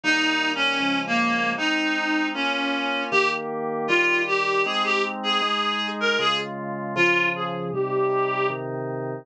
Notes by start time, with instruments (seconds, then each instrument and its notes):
0.04 drawbar organ D#3 G3 A#3, clarinet D#4
0.55 clarinet C#4
0.80 drawbar organ C#3 F3 G#3
1.07 clarinet A#3
1.58 drawbar organ G#3 C4 D#4, clarinet D#4
2.34 drawbar organ A#3 C#4 F4, clarinet C#4
3.11 drawbar organ D#3 A#3 G4, clarinet G4
3.88 drawbar organ D#3 G3 G4, clarinet F4
4.27 clarinet G4
4.65 drawbar organ G#3 C4 D#4, clarinet G#4
4.84 clarinet G4
5.23 clarinet G#4
5.42 drawbar organ G#3 D#4 G#4
6.00 clarinet A#4
6.19 drawbar organ C#3 G#3 F4, clarinet G#4
6.96 drawbar organ C#3 F3 F4, clarinet F4
7.36 clarinet G#4
7.73 drawbar organ C3 G3 D#4, clarinet G4
8.50 drawbar organ C3 D#3 D#4